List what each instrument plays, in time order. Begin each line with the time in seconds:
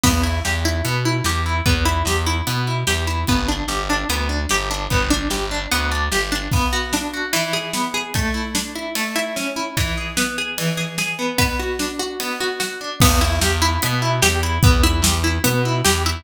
0.03 electric bass (finger) E2, acoustic guitar (steel) B3, kick, crash
0.23 acoustic guitar (steel) E4
0.45 electric bass (finger) E2, acoustic guitar (steel) G4, snare
0.65 acoustic guitar (steel) E4
0.85 electric bass (finger) B2, acoustic guitar (steel) B3, closed hi-hat
1.05 acoustic guitar (steel) E4
1.24 electric bass (finger) E2, acoustic guitar (steel) G4, snare
1.46 acoustic guitar (steel) E4
1.66 electric bass (finger) E2, acoustic guitar (steel) B3, kick, closed hi-hat
1.85 acoustic guitar (steel) E4
2.05 electric bass (finger) E2, acoustic guitar (steel) G4, snare
2.26 acoustic guitar (steel) E4
2.47 electric bass (finger) B2, acoustic guitar (steel) B3, closed hi-hat
2.67 acoustic guitar (steel) E4
2.87 electric bass (finger) E2, acoustic guitar (steel) G4, snare
3.07 acoustic guitar (steel) E4
3.27 electric bass (finger) G1, acoustic guitar (steel) B3, kick, closed hi-hat
3.48 acoustic guitar (steel) D4
3.68 electric bass (finger) G1, acoustic guitar (steel) G4, snare
3.90 acoustic guitar (steel) D4
4.09 electric bass (finger) D2, acoustic guitar (steel) B3, closed hi-hat
4.29 acoustic guitar (steel) D4
4.49 electric bass (finger) G1, acoustic guitar (steel) G4, snare
4.71 acoustic guitar (steel) D4
4.90 electric bass (finger) G1, acoustic guitar (steel) B3, kick, closed hi-hat
5.10 acoustic guitar (steel) D4
5.30 electric bass (finger) G1, acoustic guitar (steel) G4, snare
5.51 acoustic guitar (steel) D4
5.71 electric bass (finger) D2, acoustic guitar (steel) B3, closed hi-hat
5.92 acoustic guitar (steel) D4
6.12 electric bass (finger) G1, acoustic guitar (steel) G4, snare
6.32 acoustic guitar (steel) D4
6.52 acoustic guitar (steel) B3, kick, crash
6.73 acoustic guitar (steel) F#4
6.93 acoustic guitar (steel) D4, snare
7.14 acoustic guitar (steel) F#4
7.33 acoustic guitar (steel) E3, ride
7.53 acoustic guitar (steel) G#4
7.73 acoustic guitar (steel) B3, snare
7.94 acoustic guitar (steel) G#4
8.14 acoustic guitar (steel) A3, kick, ride
8.34 acoustic guitar (steel) E4
8.55 acoustic guitar (steel) D4, snare
8.75 acoustic guitar (steel) E4
8.95 acoustic guitar (steel) A3, ride
9.16 acoustic guitar (steel) E4
9.36 acoustic guitar (steel) C#4, snare
9.56 acoustic guitar (steel) E4
9.77 acoustic guitar (steel) E3, kick, ride
9.98 acoustic guitar (steel) G#4
10.17 acoustic guitar (steel) B3, snare
10.38 acoustic guitar (steel) G#4
10.58 acoustic guitar (steel) E3, ride
10.77 acoustic guitar (steel) G#4
10.98 acoustic guitar (steel) G#4, snare
11.19 acoustic guitar (steel) B3
11.38 acoustic guitar (steel) B3, kick, ride
11.59 acoustic guitar (steel) F#4
11.79 acoustic guitar (steel) D4, snare
11.99 acoustic guitar (steel) F#4
12.20 acoustic guitar (steel) B3, ride
12.40 acoustic guitar (steel) F#4
12.60 acoustic guitar (steel) F#4, snare
12.81 acoustic guitar (steel) D4
13.00 electric bass (finger) E2, acoustic guitar (steel) B3, kick, crash
13.21 acoustic guitar (steel) E4
13.41 electric bass (finger) E2, acoustic guitar (steel) G4, snare
13.62 acoustic guitar (steel) E4
13.82 electric bass (finger) B2, acoustic guitar (steel) B3, closed hi-hat
14.02 acoustic guitar (steel) E4
14.22 electric bass (finger) E2, acoustic guitar (steel) G4, snare
14.43 acoustic guitar (steel) E4
14.63 electric bass (finger) E2, acoustic guitar (steel) B3, kick, closed hi-hat
14.83 acoustic guitar (steel) E4
15.02 electric bass (finger) E2, acoustic guitar (steel) G4, snare
15.24 acoustic guitar (steel) E4
15.44 electric bass (finger) B2, acoustic guitar (steel) B3, closed hi-hat
15.65 acoustic guitar (steel) E4
15.85 electric bass (finger) E2, acoustic guitar (steel) G4, snare
16.06 acoustic guitar (steel) E4